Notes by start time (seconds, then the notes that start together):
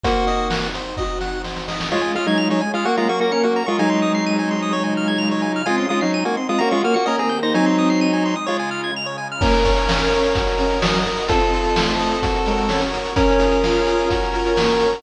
0.04 A#3 C4 D#4 F#4 C5, kick, closed hi-hat
0.27 D#5, closed hi-hat
0.50 F#5, snare
0.74 C5, closed hi-hat
0.97 F#4 D#5, kick, snare
1.21 F#5, snare
1.44 C5, snare
1.56 snare
1.68 D#5, snare
1.80 snare
1.91 G#3 C#4 F4 G#4 C#5
2.01 G#5
2.15 G#3 F4 F6
2.26 F#3 D#4 G#6
2.38 F7
2.50 F#3 D#4 C#5
2.61 G#5
2.73 G#3 F4 F6
2.85 F#3 A#3 C#4 F#4 A#4 F#5
2.97 G#3 F4 A#5
3.09 A#3 F#4 C#6
3.20 A#3 F#4 A#6
3.32 C#4 A#4 C#7
3.43 A#3 F#4 F#5
3.56 A#5
3.66 G#3 F4 C#6
3.79 F#3 G#3 C4 D#4 G#5
3.90 C6
4.02 D#6
4.15 C7
4.26 D#7
4.39 G#5
4.51 C6
4.62 D#6
4.72 C#3 G#3 F4 C#5
4.84 G#5
4.97 F6
5.08 G#6
5.18 F7
5.31 C#5
5.42 G#5
5.56 F6
5.65 G#3 C4 D#4 F4 G#5
5.77 C#4 C6
5.89 G#3 F4 D#6
6.01 F#3 C#4 D#4 C7
6.14 D#7
6.25 A#3 F#4 G#5
6.37 C4 C6
6.49 G#3 F4 D#6
6.58 A#3 C#4 F4 F#4 A#5
6.71 G#3 F4 C#6
6.83 A#3 F#4 F6
6.94 A#3 F#4 C#7
7.06 D#3 A#3 C#4 G4 A#4 D#5
7.19 C4 G#4 A#5
7.29 A#3 G6
7.43 D#4 C5 A#6
7.54 F#3 G#3 C4 D#4 G#5
7.66 C6
7.78 D#6
7.90 C7
8.01 D#7
8.13 G#5
8.25 C6
8.36 D#6
8.46 C#3 G#3 F4 C#5
8.59 G#5
8.71 F6
8.84 G#6
8.96 F7
9.06 C#5
9.18 G#5
9.32 F6
9.41 A#3 C#4 A#4 C#5 F5, kick, crash
9.53 closed hi-hat
9.64 C#5, kick, closed hi-hat
9.77 closed hi-hat
9.88 C#4 F5, snare
10.00 closed hi-hat
10.12 C#5, closed hi-hat
10.23 closed hi-hat
10.34 F#4 A#4 D#5, kick, closed hi-hat
10.47 closed hi-hat
10.58 C#4 A#4, closed hi-hat
10.71 closed hi-hat
10.82 F#3 D#5, snare
10.94 closed hi-hat
11.05 A#4, closed hi-hat
11.17 closed hi-hat
11.28 C4 F4 A4 C5 D#5, kick, closed hi-hat
11.41 closed hi-hat
11.53 A4, closed hi-hat
11.64 closed hi-hat
11.76 A3 C5, snare
11.89 closed hi-hat
11.99 D#5, closed hi-hat
12.11 closed hi-hat
12.23 F#4 A#4 C#5, kick, closed hi-hat
12.35 closed hi-hat
12.46 G#3 A#4, closed hi-hat
12.58 closed hi-hat
12.68 C#4 C#5, snare
12.81 closed hi-hat
12.93 A#4, closed hi-hat
13.05 closed hi-hat
13.16 C#4 F4 G#4 A#4, kick, closed hi-hat
13.29 closed hi-hat
13.39 G#4, closed hi-hat
13.51 closed hi-hat
13.63 F4 F5, snare
13.75 closed hi-hat
13.87 G#4, closed hi-hat
13.99 closed hi-hat
14.10 F#4 A#4 C#5, kick, closed hi-hat
14.22 closed hi-hat
14.33 F4 A#4, closed hi-hat
14.45 closed hi-hat
14.56 A#3 C#5, snare
14.69 closed hi-hat
14.80 A#4, closed hi-hat
14.93 open hi-hat